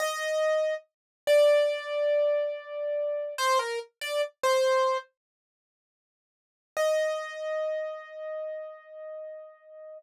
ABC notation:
X:1
M:4/4
L:1/16
Q:1/4=71
K:Eb
V:1 name="Acoustic Grand Piano"
e4 z2 d10 | c B z d z c3 z8 | e16 |]